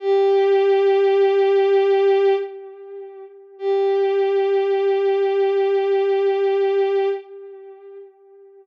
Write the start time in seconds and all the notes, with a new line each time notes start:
0.00 G4
3.59 G4